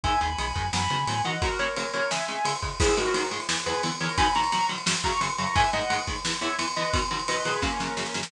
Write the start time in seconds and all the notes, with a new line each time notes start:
0.03 G#1 D#3 G#3 E5 G#5, kick, ride
0.21 D#2 D#3 G#3 G#5 B5, ride
0.38 B1 D#3 G#3, ride
0.55 F#2 D#3 G#3, kick, ride
0.73 F#2 D#3 F#3 B3 G#5 B5, snare
0.90 C#3 D#3 F#3 B3, ride
1.07 A2 D#3 F#3 B3, ride
1.24 D#3 E3 F#3 B3 D#5 F#5, ride
1.42 C#3 F#3 A#3 F#4 A#4, kick, ride
1.59 C#3 F#3 A#3 A#4 C#5, ride
1.76 C#3 F#3 A#3 A#4 C#5, ride
1.93 C#3 F#3 A#3 A#4 C#5, ride
2.11 C#3 G#3 E5 G#5, snare
2.28 C#3 G#3, ride
2.45 C#3 G#3, ride
2.62 C#3 G#3, kick, ride
2.80 G#2 D#3 G#3 E4 G#4, kick, crash
2.88 ride
2.97 G#2 D#3 G#3 F#4 A#4, ride
3.06 ride
3.14 G#2 D#3 G#3, ride
3.23 ride
3.31 G#2 D#3 G#3, ride
3.40 ride
3.49 E2 E3 B3, snare
3.57 ride
3.66 E2 E3 B3 G#4 B4, ride
3.74 ride
3.83 E2 E3 B3, ride
3.92 ride
4.00 E2 E3 B3 A#4 C#5, ride
4.09 ride
4.18 B2 D#3 F#3 G#5 B5, kick, ride
4.26 ride
4.35 B2 D#3 F#3 A#5 C#6, ride
4.44 ride
4.52 B2 D#3 F#3, ride
4.61 ride
4.69 B2 D#3 F#3, ride
4.78 ride
4.86 F#2 C#3 F#3, snare
4.95 ride
5.04 F#2 C#3 F#3 A#5 C#6, kick, ride
5.13 ride
5.21 F#2 C#3 F#3, ride
5.30 ride
5.38 F#2 C#3 F#3 A#5 C#6, ride
5.47 ride
5.55 G#2 D#3 G#3 E5 G#5, kick, ride
5.64 ride
5.73 G#2 D#3 G#3 D#5 F#5, ride
5.82 ride
5.90 G#2 D#3 G#3, ride
5.99 ride
6.07 G#2 D#3 G#3, kick, ride
6.16 ride
6.25 E2 E3 B3, snare
6.33 ride
6.41 E2 E3 B3 C#5 E5, ride
6.50 ride
6.58 E2 E3 B3, ride
6.68 ride
6.76 E2 E3 B3 B4 D#5, ride
6.85 ride
6.93 B2 D#3 F#3, kick, ride
7.02 ride
7.11 B2 D#3 F#3, ride
7.19 ride
7.28 B2 D#3 F#3 B4 D#5, ride
7.37 ride
7.45 B2 D#3 F#3 G#4 B4, ride
7.54 ride
7.62 F#2 C#3 F#3 A#3 C#4, kick, snare
7.80 F#2 C#3 F#3, snare
7.97 F#2 C#3 F#3, snare
8.06 snare
8.14 F#2 C#3 F#3, snare
8.23 snare